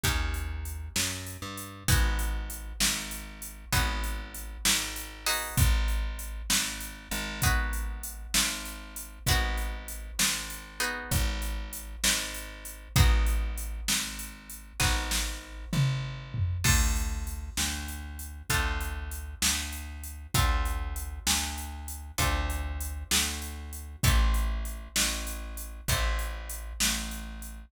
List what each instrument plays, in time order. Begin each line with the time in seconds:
0.03 electric bass (finger) D#2, acoustic guitar (steel) A#3 C#4 D#4 G4, kick, closed hi-hat
0.34 closed hi-hat
0.65 closed hi-hat
0.96 electric bass (finger) F#2, snare
1.27 closed hi-hat
1.42 electric bass (finger) G2
1.57 closed hi-hat
1.88 electric bass (finger) G#1, acoustic guitar (steel) B3 D#4 F#4 G#4, kick, closed hi-hat
2.19 closed hi-hat
2.50 closed hi-hat
2.80 electric bass (finger) G#1, snare
3.11 closed hi-hat
3.42 closed hi-hat
3.72 electric bass (finger) G#1, acoustic guitar (steel) B3 D#4 F#4 G#4, kick, closed hi-hat
4.04 closed hi-hat
4.34 closed hi-hat
4.65 electric bass (finger) G#1, snare
4.96 closed hi-hat
5.26 acoustic guitar (steel) B3 D#4 F#4 G#4, open hi-hat
5.57 electric bass (finger) G#1, kick, closed hi-hat
5.88 closed hi-hat
6.19 closed hi-hat
6.50 electric bass (finger) G#1, snare
6.80 closed hi-hat
7.11 electric bass (finger) G#1, closed hi-hat
7.42 acoustic guitar (steel) B3 D#4 F#4 G#4, kick, closed hi-hat
7.73 closed hi-hat
8.03 closed hi-hat
8.34 electric bass (finger) G#1, snare
8.65 closed hi-hat
8.96 closed hi-hat
9.26 electric bass (finger) G#1, acoustic guitar (steel) B3 D#4 F#4 G#4, kick, closed hi-hat
9.58 closed hi-hat
9.88 closed hi-hat
10.19 electric bass (finger) G#1, snare
10.50 closed hi-hat
10.80 acoustic guitar (steel) B3 D#4 F#4 G#4, closed hi-hat
11.11 electric bass (finger) G#1, kick, closed hi-hat
11.42 closed hi-hat
11.73 closed hi-hat
12.04 electric bass (finger) G#1, snare
12.34 closed hi-hat
12.65 closed hi-hat
12.96 electric bass (finger) G#1, acoustic guitar (steel) B3 D#4 F#4 G#4, kick, closed hi-hat
13.27 closed hi-hat
13.58 closed hi-hat
13.88 electric bass (finger) G#1, snare
14.19 closed hi-hat
14.50 closed hi-hat
14.80 electric bass (finger) G#1, acoustic guitar (steel) B3 D#4 F#4 G#4, kick, snare
15.11 snare
15.73 electric bass (finger) G#1, mid tom
16.34 floor tom
16.64 electric bass (finger) D2, acoustic guitar (steel) C4 D4 F4 A4, kick, crash
16.96 closed hi-hat
17.27 closed hi-hat
17.57 electric bass (finger) D2, snare
17.88 closed hi-hat
18.19 closed hi-hat
18.49 electric bass (finger) D2, acoustic guitar (steel) C4 D4 F4 A4, kick, closed hi-hat
18.81 closed hi-hat
19.11 closed hi-hat
19.42 electric bass (finger) D2, snare
19.73 closed hi-hat
20.04 closed hi-hat
20.34 electric bass (finger) D2, acoustic guitar (steel) C4 D4 F4 A4, kick, closed hi-hat
20.65 closed hi-hat
20.96 closed hi-hat
21.27 electric bass (finger) D2, snare
21.58 closed hi-hat
21.88 closed hi-hat
22.18 electric bass (finger) D2, acoustic guitar (steel) C4 D4 F4 A4, kick, closed hi-hat
22.50 closed hi-hat
22.81 closed hi-hat
23.11 electric bass (finger) D2, snare
23.42 closed hi-hat
23.73 closed hi-hat
24.03 electric bass (finger) A1, acoustic guitar (steel) C4 E4 G4 A4, kick, closed hi-hat
24.34 closed hi-hat
24.65 closed hi-hat
24.96 electric bass (finger) A1, snare
25.27 closed hi-hat
25.57 closed hi-hat
25.88 electric bass (finger) A1, acoustic guitar (steel) C4 E4 G4 A4, kick, closed hi-hat
26.19 closed hi-hat
26.49 closed hi-hat
26.80 electric bass (finger) A1, snare
27.11 closed hi-hat
27.42 closed hi-hat